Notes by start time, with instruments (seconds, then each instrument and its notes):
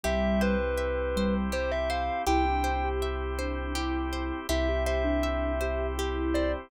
0.04 synth bass 2 C2, ocarina G3, drawbar organ C4 E4 G4, orchestral harp G4, kalimba E5
0.41 kalimba B4, orchestral harp C5
0.78 orchestral harp E5
1.16 ocarina G3, orchestral harp C5
1.52 orchestral harp G4, kalimba C5
1.72 kalimba E5
1.90 orchestral harp C5, kalimba F5
2.27 synth bass 2 C2, drawbar organ C4 E4 G4, ocarina E4, orchestral harp G4, kalimba G5
2.45 ocarina D4
2.64 orchestral harp C5
2.84 ocarina G4
3.02 orchestral harp E5
3.38 ocarina D4, orchestral harp C5
3.75 ocarina E4, orchestral harp G4
4.13 orchestral harp C5
4.49 synth bass 2 C2, drawbar organ C4 E4 G4, ocarina E4, orchestral harp G4, kalimba E5
4.68 ocarina G4
4.86 orchestral harp C5, kalimba E5
5.04 ocarina D4
5.23 orchestral harp E5
5.61 ocarina G4, orchestral harp C5
5.96 ocarina E4, orchestral harp G4
6.34 orchestral harp C5, kalimba D5